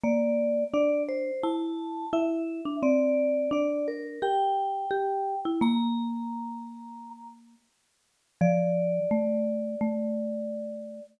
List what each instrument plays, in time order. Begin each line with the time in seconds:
0.03 marimba A#3, vibraphone D5
0.74 marimba D4, vibraphone D5
1.09 vibraphone C5
1.43 marimba E4, vibraphone A5
2.13 marimba E4, vibraphone E5
2.65 marimba D4
2.83 marimba C4, vibraphone D5
3.51 marimba D4, vibraphone D5
3.88 vibraphone A#4
4.22 marimba G4, vibraphone G5
4.91 marimba G4
5.45 marimba E4
5.61 marimba A#3, vibraphone A#5
8.41 marimba F3, vibraphone D5
9.11 marimba A3
9.81 marimba A3